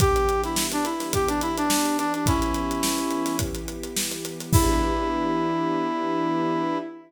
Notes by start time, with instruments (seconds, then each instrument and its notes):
0.00 string ensemble 1 E3 B3 D4 G4, brass section G4, kick, closed hi-hat
0.16 closed hi-hat
0.29 closed hi-hat
0.44 brass section E4, snare, closed hi-hat
0.56 snare
0.72 brass section D4, closed hi-hat
0.85 brass section E4, closed hi-hat
1.00 snare, closed hi-hat
1.13 brass section G4, kick, closed hi-hat
1.28 brass section D4, closed hi-hat
1.41 brass section E4, closed hi-hat
1.57 brass section D4, closed hi-hat
1.70 snare
1.85 closed hi-hat
1.98 brass section D4, closed hi-hat
2.14 brass section D4, closed hi-hat
2.26 string ensemble 1 E3 B3 E4 G4, brass section C#4 E4, kick, closed hi-hat
2.42 closed hi-hat
2.54 closed hi-hat
2.71 closed hi-hat
2.83 snare
2.98 closed hi-hat
3.11 closed hi-hat
3.26 snare, closed hi-hat
3.39 kick, closed hi-hat
3.55 closed hi-hat
3.68 closed hi-hat
3.83 closed hi-hat
3.96 snare
4.11 closed hi-hat
4.25 closed hi-hat
4.40 snare, closed hi-hat
4.53 string ensemble 1 E3 B3 D4 G4, brass section E4, kick, crash